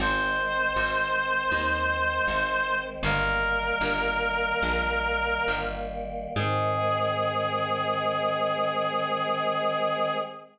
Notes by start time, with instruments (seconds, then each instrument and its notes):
0.00 electric bass (finger) G#1, choir aahs D#3 G#3 C4, clarinet C5
0.76 electric bass (finger) G#1
1.52 electric bass (finger) D#2
2.28 electric bass (finger) G#1
3.03 electric bass (finger) G1, choir aahs D#3 G3 A#3, clarinet A#4
3.81 electric bass (finger) G1
4.62 electric bass (finger) A#1
5.48 electric bass (finger) G1
6.36 electric bass (finger) G#2, choir aahs D#3 G#3 C4, clarinet G#4